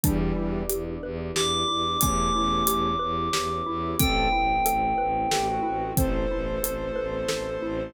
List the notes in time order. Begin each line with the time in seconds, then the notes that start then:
0.03 E2 E3 G3 B3 D4 E4 G4, kick, closed hi-hat
0.36 E2 E4
0.69 E2 G4, closed hi-hat
1.03 E2 B4
1.36 E2 G4 D6, snare
1.68 E2 E4
2.01 E2 A3 B3 C#4 E4 G4 D6, kick, closed hi-hat
2.35 E2 E4
2.67 E2 G4, closed hi-hat
2.99 E2 B4
3.33 E2 G4, snare
3.66 E2 E4
3.99 A1 A3 B3 C4 E4 A4 G5, kick, closed hi-hat
4.32 A1 E4
4.65 A1 A4, closed hi-hat
4.98 A1 B4
5.31 A1 G4 A4, snare
5.48 F#4
5.63 A1 E4
5.97 A1 A3 B3 C4 E4 A4 C5, kick, closed hi-hat
6.30 A1 E4
6.63 A1 A4, closed hi-hat
6.96 A1 B4
7.28 A1 A4, snare
7.62 A1 E4